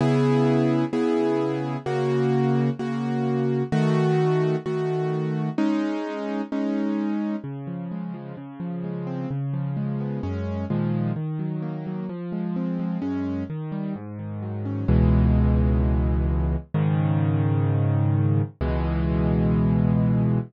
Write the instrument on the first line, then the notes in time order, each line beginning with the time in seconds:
acoustic grand piano
0.01 C#3 B3 E4 G#4
0.93 C#3 B3 E4 G#4
1.86 C#3 A#3 F#4
2.79 C#3 A#3 F#4
3.72 D#3 A3 F#4
4.66 D#3 A3 F#4
5.58 G#3 C#4 D#4
6.52 G#3 C#4 D#4
7.44 C#3
7.67 F3
7.92 G#3
8.14 F3
8.37 C#3
8.60 F3
8.84 G#3
9.07 C4
9.31 C#3
9.54 F3
9.77 G#3
10.00 B3
10.23 F#2 G#3 C#4
10.70 A#2 D#3 F3 G#3
11.16 D#3
11.39 F#3
11.62 A#3
11.87 F#3
12.09 F3
12.32 G#3
12.56 C4
12.80 G#3
13.02 F#2 G#3 C#4
13.50 D#3
13.72 G3
13.96 G#2
14.19 D#3
14.42 F#3
14.65 C#4
14.88 C#2 B2 E3 G#3
16.74 G#2 C#3 D#3
18.61 C#2 B2 E3 G#3